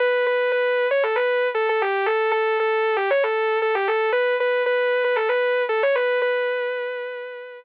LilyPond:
\new Staff { \time 4/4 \key b \minor \tempo 4 = 116 b'8 b'8 b'8. cis''16 a'16 b'8. a'16 a'16 g'8 | a'8 a'8 a'8. g'16 cis''16 a'8. a'16 g'16 a'8 | b'8 b'8 b'8. b'16 a'16 b'8. a'16 cis''16 b'8 | b'2. r4 | }